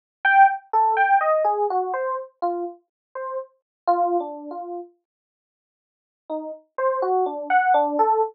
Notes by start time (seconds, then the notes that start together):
0.24 G5
0.73 A4
0.97 G5
1.21 D#5
1.44 G#4
1.70 F#4
1.94 C5
2.42 F4
3.15 C5
3.87 F4
4.20 D4
4.51 F4
6.29 D#4
6.78 C5
7.02 F#4
7.26 D4
7.50 F#5
7.74 D4
7.99 A4